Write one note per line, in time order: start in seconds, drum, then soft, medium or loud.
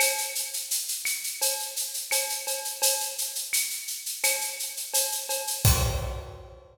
0.00 cowbell loud
0.00 claves loud
0.00 shaker loud
0.18 shaker medium
0.35 shaker medium
0.53 shaker medium
0.71 shaker loud
0.88 shaker medium
1.05 claves loud
1.05 shaker loud
1.24 shaker medium
1.41 cowbell medium
1.41 shaker loud
1.59 shaker medium
1.76 shaker medium
1.94 shaker medium
2.11 cowbell medium
2.11 claves loud
2.11 shaker loud
2.29 shaker medium
2.47 cowbell medium
2.47 shaker medium
2.64 shaker medium
2.82 cowbell loud
2.82 shaker loud
3.00 shaker medium
3.18 shaker medium
3.35 shaker medium
3.53 claves loud
3.53 shaker loud
3.70 shaker medium
3.87 shaker medium
4.06 shaker medium
4.23 cowbell medium
4.23 claves loud
4.23 shaker loud
4.41 shaker medium
4.59 shaker medium
4.77 shaker medium
4.94 cowbell medium
4.94 shaker loud
5.12 shaker medium
5.29 cowbell medium
5.29 shaker medium
5.47 shaker medium
5.65 kick loud
5.65 crash loud